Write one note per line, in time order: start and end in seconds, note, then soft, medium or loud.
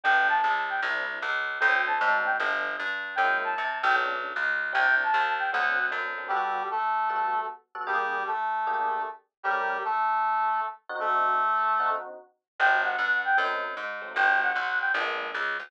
0.04 0.41 G1 medium
0.04 0.35 G3 loud
0.04 0.35 A3 medium
0.04 0.35 B3 medium
0.04 0.35 D4 medium
0.04 0.27 G5 medium
0.29 0.61 A5 medium
0.44 0.80 C#2 medium
0.70 0.81 G5 medium
0.82 1.19 C2 loud
0.82 1.14 G3 medium
0.82 1.14 C4 medium
0.82 1.14 D4 medium
0.82 1.14 E4 medium
1.22 1.59 C#2 medium
1.60 1.98 D2 loud
1.60 1.92 F#3 loud
1.60 1.92 A3 loud
1.60 1.92 C4 loud
1.60 1.92 D4 medium
1.60 1.82 G5 medium
1.87 2.18 A5 medium
2.01 2.37 G#2 medium
2.01 2.32 F#3 medium
2.01 2.32 A3 medium
2.01 2.32 C4 medium
2.01 2.32 D4 medium
2.25 2.36 G5 medium
2.40 2.76 G1 loud
2.40 2.71 G3 medium
2.40 2.71 A3 medium
2.40 2.71 B3 medium
2.40 2.71 D4 loud
2.79 3.16 G2 medium
3.15 3.54 F#2 medium
3.15 3.48 F#3 medium
3.15 3.48 G#3 medium
3.15 3.48 A#3 medium
3.15 3.48 E4 medium
3.15 3.39 G5 medium
3.44 3.79 A5 medium
3.58 3.83 C3 medium
3.82 4.33 B1 loud
3.82 3.95 G5 medium
3.95 4.26 A3 loud
3.95 4.26 B3 medium
3.95 4.26 C#4 medium
3.95 4.26 D4 loud
4.36 4.73 C#2 medium
4.72 5.11 C2 medium
4.72 5.04 G3 medium
4.72 5.04 C4 medium
4.72 5.04 D4 medium
4.72 5.04 E4 medium
4.72 4.95 G5 loud
5.03 5.33 A5 medium
5.14 5.50 D#2 loud
5.39 5.51 G5 medium
5.52 5.91 D2 loud
5.52 5.84 F#3 medium
5.52 5.84 A3 loud
5.52 5.84 C4 medium
5.52 5.84 D4 medium
5.52 5.86 F#5 medium
5.91 6.29 F#2 medium
5.91 6.09 F#3 medium
5.91 6.09 A3 medium
5.91 6.09 C4 medium
5.91 6.09 D4 medium
6.18 6.27 F#3 medium
6.18 6.27 A3 medium
6.18 6.27 C4 medium
6.18 6.27 D4 medium
6.28 6.63 G3 medium
6.28 6.62 G3 loud
6.28 6.62 B3 loud
6.28 6.62 F#4 loud
6.28 6.63 G4 medium
6.28 6.62 A4 loud
6.71 7.40 A3 medium
6.71 7.40 A4 medium
7.09 7.41 G3 medium
7.09 7.41 B3 medium
7.09 7.41 F#4 medium
7.09 7.41 A4 loud
7.75 7.84 G3 medium
7.75 7.84 B3 medium
7.75 7.84 F#4 medium
7.75 7.84 A4 loud
7.87 8.23 G3 medium
7.87 8.18 A#3 loud
7.87 8.18 D4 loud
7.87 8.18 G4 loud
7.87 8.23 G4 medium
7.87 8.18 G#4 loud
8.27 9.02 A3 medium
8.27 9.02 A4 medium
8.67 8.98 A#3 loud
8.67 8.98 D4 medium
8.67 8.98 G4 loud
8.67 8.98 G#4 medium
9.43 9.77 G3 medium
9.43 9.76 A3 loud
9.43 9.76 C#4 loud
9.43 9.77 G4 medium
9.43 9.76 G4 loud
9.43 9.76 A#4 loud
9.84 10.60 A3 medium
9.84 10.60 A4 medium
10.89 11.34 D3 loud
10.89 11.34 C4 loud
10.89 11.34 D#4 loud
10.89 11.34 F#4 loud
11.00 11.89 A3 medium
11.00 11.89 A4 medium
11.79 12.11 D3 medium
11.79 12.11 C4 medium
11.79 12.11 D#4 medium
11.79 12.11 F#4 loud
12.59 12.96 G1 loud
12.59 12.91 F#3 loud
12.59 12.91 G3 loud
12.59 12.91 B3 medium
12.59 12.91 D4 medium
12.59 12.81 G5 medium
12.84 13.22 F#5 medium
12.99 13.35 G2 medium
13.25 13.37 G5 medium
13.37 13.75 F#2 medium
13.37 13.68 F#3 medium
13.37 13.68 A3 medium
13.37 13.68 C4 loud
13.37 13.68 D#4 medium
13.77 14.13 G#2 medium
14.01 14.11 F#3 medium
14.01 14.11 A3 medium
14.01 14.11 C4 medium
14.01 14.11 D#4 medium
14.14 14.53 G1 medium
14.14 14.46 F#3 medium
14.14 14.46 G3 medium
14.14 14.46 B3 loud
14.14 14.46 D4 medium
14.14 14.40 G5 medium
14.43 14.79 F#5 medium
14.55 14.92 B1 medium
14.81 14.92 G5 medium
14.94 15.31 A#1 loud
14.94 15.26 G#3 loud
14.94 15.26 A#3 loud
14.94 15.26 B3 loud
14.94 15.26 D4 medium
15.34 15.58 C#2 medium
15.59 15.70 D2 medium